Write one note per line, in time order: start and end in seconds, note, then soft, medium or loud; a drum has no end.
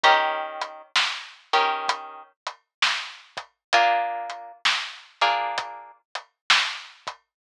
0.03 0.82 D#3 medium
0.03 0.82 C#4 medium
0.03 0.82 G4 medium
0.03 0.82 A#4 medium
0.03 kick loud
0.03 closed hi-hat medium
0.61 closed hi-hat medium
0.96 snare loud
1.53 2.23 D#3 medium
1.53 2.23 C#4 medium
1.53 2.23 G4 medium
1.53 2.23 A#4 medium
1.53 closed hi-hat medium
1.88 kick medium
1.88 closed hi-hat loud
2.47 closed hi-hat medium
2.82 snare loud
3.37 kick medium
3.37 closed hi-hat medium
3.73 4.52 A#3 medium
3.73 4.52 D4 medium
3.73 4.52 F4 loud
3.73 4.52 G#4 medium
3.73 kick loud
3.73 closed hi-hat loud
4.30 closed hi-hat medium
4.65 snare loud
5.21 5.91 A#3 medium
5.21 5.91 D4 medium
5.21 5.91 F4 medium
5.21 5.91 G#4 medium
5.21 closed hi-hat medium
5.58 kick medium
5.58 closed hi-hat medium
6.15 closed hi-hat medium
6.50 snare loud
7.07 kick medium
7.07 closed hi-hat medium